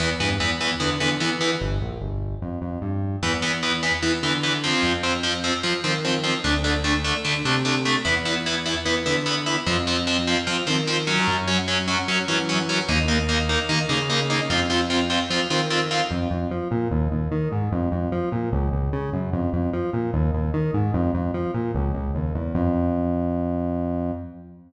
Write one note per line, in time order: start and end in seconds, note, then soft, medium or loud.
0.00 0.17 E2 medium
0.00 0.08 E3 loud
0.00 0.08 B3 loud
0.20 0.37 G2 medium
0.20 0.28 E3 medium
0.20 0.28 B3 medium
0.40 0.74 E2 medium
0.40 0.48 E3 medium
0.40 0.48 B3 medium
0.61 0.69 E3 medium
0.61 0.69 B3 medium
0.80 0.98 D3 medium
0.80 0.88 E3 medium
0.80 0.88 B3 medium
1.00 1.18 D3 medium
1.00 1.08 E3 medium
1.00 1.08 B3 medium
1.20 1.28 E3 medium
1.20 1.55 E3 medium
1.20 1.28 B3 medium
1.41 1.49 E3 medium
1.41 1.49 B3 medium
1.61 1.78 G1 medium
1.81 1.98 A#1 medium
2.01 2.36 G1 medium
2.42 2.59 F2 medium
2.62 2.79 F2 medium
2.82 3.16 G2 medium
3.22 3.91 E2 medium
3.22 3.31 E3 loud
3.22 3.31 B3 loud
3.42 3.50 E3 medium
3.42 3.50 B3 medium
3.63 3.71 E3 medium
3.63 3.71 B3 medium
3.83 3.91 E3 medium
3.83 3.91 B3 medium
4.03 4.11 E3 medium
4.03 4.20 E3 medium
4.03 4.11 B3 medium
4.23 4.74 D3 medium
4.23 4.31 E3 medium
4.23 4.31 B3 medium
4.43 4.51 E3 medium
4.43 4.51 B3 medium
4.64 4.92 F3 medium
4.64 4.92 C4 loud
4.83 5.52 F2 medium
5.03 5.11 F3 medium
5.03 5.11 C4 medium
5.23 5.31 F3 medium
5.23 5.31 C4 medium
5.44 5.52 F3 medium
5.44 5.52 C4 medium
5.63 5.71 F3 medium
5.63 5.81 F3 medium
5.63 5.71 C4 medium
5.84 6.35 D#3 medium
5.84 5.92 F3 medium
5.84 5.92 C4 medium
6.05 6.13 F3 medium
6.05 6.13 C4 medium
6.24 6.32 F3 medium
6.24 6.32 C4 medium
6.44 7.13 D2 medium
6.44 6.52 A3 loud
6.44 6.52 D4 loud
6.64 6.72 A3 medium
6.64 6.72 D4 medium
6.84 6.92 A3 medium
6.84 6.92 D4 medium
7.04 7.13 A3 medium
7.04 7.13 D4 medium
7.25 7.42 D3 medium
7.25 7.33 A3 medium
7.25 7.33 D4 medium
7.45 7.96 C3 medium
7.45 7.53 A3 medium
7.45 7.53 D4 medium
7.65 7.73 A3 loud
7.65 7.73 D4 medium
7.85 7.93 A3 medium
7.85 7.93 D4 medium
8.05 8.74 E2 medium
8.05 8.13 B3 loud
8.05 8.13 E4 loud
8.25 8.33 B3 medium
8.25 8.33 E4 medium
8.46 8.54 B3 medium
8.46 8.54 E4 medium
8.66 8.74 B3 medium
8.66 8.74 E4 medium
8.86 9.03 E3 medium
8.86 8.94 B3 medium
8.86 8.94 E4 medium
9.06 9.57 D3 medium
9.06 9.14 B3 medium
9.06 9.14 E4 medium
9.26 9.34 B3 medium
9.26 9.34 E4 medium
9.46 9.54 B3 medium
9.46 9.54 E4 loud
9.66 10.35 F2 medium
9.66 9.75 F3 loud
9.66 9.75 C4 loud
9.87 9.95 F3 loud
9.87 9.95 C4 medium
10.07 10.15 F3 loud
10.07 10.15 C4 loud
10.27 10.35 F3 loud
10.27 10.35 C4 medium
10.47 10.55 F3 loud
10.47 10.64 F3 medium
10.47 10.55 C4 medium
10.67 11.19 D#3 medium
10.67 10.75 F3 loud
10.67 10.75 C4 loud
10.87 10.95 F3 loud
10.87 10.95 C4 loud
11.07 11.35 F#3 loud
11.07 11.35 C#4 loud
11.28 11.96 F#2 medium
11.48 11.56 F#3 loud
11.48 11.56 C#4 medium
11.68 11.76 F#3 loud
11.68 11.76 C#4 loud
11.88 11.96 F#3 loud
11.88 11.96 C#4 loud
12.08 12.25 F#3 medium
12.08 12.16 F#3 loud
12.08 12.16 C#4 loud
12.28 12.79 E3 medium
12.28 12.36 F#3 loud
12.28 12.36 C#4 loud
12.49 12.57 F#3 medium
12.49 12.57 C#4 loud
12.69 12.77 F#3 loud
12.69 12.77 C#4 loud
12.89 13.57 D#2 medium
12.89 12.97 A#3 loud
12.89 12.97 D#4 loud
13.08 13.16 A#3 medium
13.08 13.16 D#4 loud
13.29 13.37 A#3 loud
13.29 13.37 D#4 loud
13.49 13.57 A#3 loud
13.49 13.57 D#4 medium
13.69 13.86 D#3 medium
13.69 13.77 A#3 loud
13.69 13.77 D#4 loud
13.89 14.41 C#3 medium
13.89 13.97 A#3 loud
13.89 13.97 D#4 loud
14.10 14.18 A#3 loud
14.10 14.18 D#4 loud
14.30 14.38 A#3 loud
14.30 14.38 D#4 loud
14.50 15.18 F2 medium
14.50 14.58 C4 loud
14.50 14.58 F4 loud
14.70 14.78 C4 loud
14.70 14.78 F4 loud
14.90 14.98 C4 loud
14.90 14.98 F4 loud
15.10 15.18 C4 medium
15.10 15.18 F4 loud
15.30 15.47 F3 medium
15.30 15.39 C4 loud
15.30 15.39 F4 loud
15.50 16.02 D#3 medium
15.50 15.58 C4 loud
15.50 15.58 F4 loud
15.70 15.79 C4 loud
15.70 15.79 F4 loud
15.91 15.99 C4 medium
15.91 15.99 F4 loud
16.11 16.28 F2 medium
16.31 16.48 F2 medium
16.51 16.68 F3 medium
16.71 16.88 A#2 medium
16.91 17.08 D#2 medium
17.11 17.29 D#2 medium
17.32 17.49 D#3 medium
17.52 17.69 G#2 medium
17.72 17.89 F2 loud
17.92 18.09 F2 medium
18.12 18.29 F3 medium
18.32 18.49 A#2 medium
18.52 18.69 C#2 loud
18.72 18.90 C#2 medium
18.93 19.10 C#3 medium
19.13 19.30 F#2 medium
19.33 19.50 F2 medium
19.53 19.70 F2 medium
19.73 19.90 F3 medium
19.93 20.10 A#2 medium
20.13 20.31 D#2 loud
20.34 20.51 D#2 medium
20.54 20.71 D#3 medium
20.74 20.91 G#2 medium
20.94 21.11 F2 loud
21.14 21.31 F2 medium
21.34 21.51 F3 medium
21.54 21.71 A#2 medium
21.74 21.92 C#2 loud
21.95 22.12 C#2 medium
22.15 22.33 D#2 medium
22.35 22.53 E2 medium
22.55 24.12 F2 loud